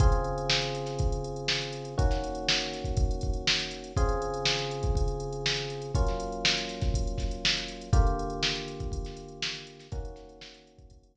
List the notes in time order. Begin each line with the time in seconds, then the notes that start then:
0.00 C#3 C4 F4 G#4, kick, closed hi-hat
0.12 closed hi-hat
0.24 closed hi-hat
0.38 closed hi-hat
0.49 snare
0.62 closed hi-hat
0.75 closed hi-hat
0.86 snare, closed hi-hat
0.99 kick, closed hi-hat
1.12 closed hi-hat
1.24 closed hi-hat
1.36 closed hi-hat
1.48 snare
1.62 closed hi-hat
1.73 closed hi-hat
1.85 closed hi-hat
1.98 D#3 A#3 C#4 F#4, kick, closed hi-hat
2.11 snare, closed hi-hat
2.24 closed hi-hat
2.35 closed hi-hat
2.48 snare
2.60 closed hi-hat
2.73 snare, closed hi-hat
2.84 kick, closed hi-hat
2.97 kick, closed hi-hat
3.11 closed hi-hat
3.21 kick, closed hi-hat
3.33 closed hi-hat
3.47 snare
3.60 closed hi-hat
3.71 closed hi-hat
3.84 closed hi-hat
3.96 C#3 C4 F4 G#4, kick, closed hi-hat
4.09 closed hi-hat
4.22 closed hi-hat
4.34 closed hi-hat
4.45 snare
4.58 snare, closed hi-hat
4.71 closed hi-hat
4.83 kick, closed hi-hat
4.95 kick, closed hi-hat
5.08 closed hi-hat
5.20 closed hi-hat
5.33 closed hi-hat
5.46 snare
5.57 closed hi-hat
5.70 closed hi-hat
5.82 closed hi-hat
5.95 F#3 A#3 C#4 F4, kick, closed hi-hat
6.07 snare, closed hi-hat
6.20 closed hi-hat
6.32 closed hi-hat
6.45 snare
6.58 closed hi-hat
6.69 snare, closed hi-hat
6.81 kick, snare, closed hi-hat
6.94 kick, closed hi-hat
7.07 closed hi-hat
7.18 kick, snare, closed hi-hat
7.31 closed hi-hat
7.45 snare
7.57 closed hi-hat
7.68 closed hi-hat
7.81 closed hi-hat
7.93 D3 A#3 F4 G4, kick, closed hi-hat
8.07 closed hi-hat
8.19 closed hi-hat
8.30 closed hi-hat
8.43 snare
8.55 snare, closed hi-hat
8.68 closed hi-hat
8.80 kick, closed hi-hat
8.92 kick, closed hi-hat
9.05 snare, closed hi-hat
9.17 closed hi-hat
9.28 closed hi-hat
9.42 snare
9.55 closed hi-hat
9.67 closed hi-hat
9.79 snare, closed hi-hat
9.92 D#3 A#3 C#4 F#4, kick, closed hi-hat
10.05 closed hi-hat
10.16 snare, closed hi-hat
10.29 closed hi-hat
10.41 snare
10.54 closed hi-hat
10.67 closed hi-hat
10.79 kick, closed hi-hat
10.90 kick, closed hi-hat
11.03 closed hi-hat
11.15 kick, closed hi-hat